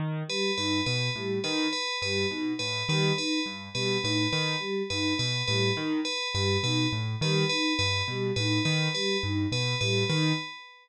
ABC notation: X:1
M:6/4
L:1/8
Q:1/4=104
K:none
V:1 name="Acoustic Grand Piano" clef=bass
_E, z G,, B,, A,, E, z G,, B,, A,, E, z | G,, B,, A,, _E, z G,, B,, A,, E, z G,, B,, | A,, _E, z G,, B,, A,, E, z G,, B,, A,, E, |]
V:2 name="Choir Aahs"
z G, _E z G, E z G, E z G, E | z G, _E z G, E z G, E z G, E | z G, _E z G, E z G, E z G, E |]
V:3 name="Tubular Bells"
z B B B z B B B z B B B | z B B B z B B B z B B B | z B B B z B B B z B B B |]